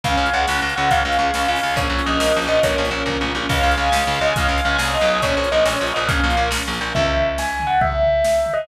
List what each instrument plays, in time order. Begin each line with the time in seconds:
0.03 electric bass (finger) C#2, string ensemble 1 C#4, brass section C#5 F5 G#5, tubular bells F5, kick, closed hi-hat
0.17 electric bass (finger) C#2, string ensemble 1 F4
0.26 closed hi-hat
0.33 electric bass (finger) C#2, string ensemble 1 G#4, tubular bells F#5
0.48 electric bass (finger) C#2, string ensemble 1 C#4, snare
0.62 electric bass (finger) C#2, string ensemble 1 F4
0.69 closed hi-hat
0.76 electric bass (finger) C#2, string ensemble 1 G#4, tubular bells F#5
0.90 electric bass (finger) C#2, string ensemble 1 C#4, tubular bells F5, kick, closed hi-hat
1.05 electric bass (finger) C#2, string ensemble 1 F4
1.12 closed hi-hat
1.19 electric bass (finger) C#2, string ensemble 1 G#4
1.34 electric bass (finger) C#2, string ensemble 1 C#4, snare
1.48 electric bass (finger) C#2, string ensemble 1 F4, tubular bells F5
1.55 open hi-hat
1.63 electric bass (finger) C#2, string ensemble 1 G#4
1.76 electric bass (finger) A#1, string ensemble 1 C#4, brass section A#4 C#5 F5, tubular bells C#5, kick, closed hi-hat
1.89 electric bass (finger) A#1, string ensemble 1 F4
1.99 closed hi-hat
2.06 electric bass (finger) A#1, string ensemble 1 A#4, tubular bells D#5
2.19 electric bass (finger) A#1, string ensemble 1 C#4, snare
2.34 electric bass (finger) A#1, string ensemble 1 F4
2.42 closed hi-hat
2.48 electric bass (finger) A#1, string ensemble 1 A#4, tubular bells D#5
2.63 electric bass (finger) A#1, string ensemble 1 C#4, tubular bells C#5, kick, closed hi-hat
2.78 electric bass (finger) A#1, string ensemble 1 F4
2.85 closed hi-hat
2.91 electric bass (finger) A#1, string ensemble 1 A#4
3.06 electric bass (finger) A#1, string ensemble 1 C#4, kick, floor tom
3.21 electric bass (finger) A#1, string ensemble 1 F4, mid tom
3.35 electric bass (finger) A#1, string ensemble 1 A#4, high tom
3.49 electric bass (finger) C#2, brass section C#4 F4 G#4, string ensemble 1 C#5, tubular bells F5, kick, crash
3.63 electric bass (finger) C#2, string ensemble 1 F5
3.71 closed hi-hat
3.77 electric bass (finger) C#2, string ensemble 1 G#5
3.92 electric bass (finger) C#2, string ensemble 1 C#5, snare
4.07 electric bass (finger) C#2, string ensemble 1 F5
4.14 closed hi-hat
4.21 electric bass (finger) C#2, tubular bells D#5, string ensemble 1 G#5
4.36 electric bass (finger) C#2, string ensemble 1 C#5, tubular bells F5, kick, closed hi-hat
4.48 electric bass (finger) C#2, string ensemble 1 F5
4.58 closed hi-hat
4.65 electric bass (finger) C#2, tubular bells F5, string ensemble 1 G#5
4.78 electric bass (finger) C2, string ensemble 1 C#5, snare
4.94 tubular bells D#5, string ensemble 1 F5
5.01 electric bass (finger) B1, closed hi-hat
5.07 string ensemble 1 G#5
5.22 electric bass (finger) A#1, string ensemble 1 C#4, brass section C#4 F4 A#4, tubular bells C#5, kick, closed hi-hat
5.37 electric bass (finger) A#1, string ensemble 1 F4
5.44 closed hi-hat
5.51 electric bass (finger) A#1, string ensemble 1 A#4, tubular bells D#5
5.65 electric bass (finger) A#1, string ensemble 1 C#4, tubular bells C#5, snare
5.80 electric bass (finger) A#1, string ensemble 1 F4
5.87 closed hi-hat
5.94 electric bass (finger) A#1, string ensemble 1 A#4, tubular bells D#5
6.08 electric bass (finger) A#1, string ensemble 1 C#4, tubular bells F5, kick, closed hi-hat
6.23 electric bass (finger) A#1, string ensemble 1 F4
6.30 closed hi-hat
6.37 electric bass (finger) A#1, string ensemble 1 A#4
6.51 electric bass (finger) A#1, string ensemble 1 C#4, snare
6.67 electric bass (finger) A#1, string ensemble 1 F4
6.73 closed hi-hat
6.80 electric bass (finger) A#1, string ensemble 1 A#4
6.95 electric bass (finger) C#2, tubular bells E5, kick, floor tom
7.17 floor tom
7.38 tubular bells G#5, snare
7.60 floor tom
7.67 tubular bells F#5
7.81 tubular bells E5, kick, floor tom
8.03 floor tom
8.24 snare
8.46 floor tom
8.53 tubular bells D#5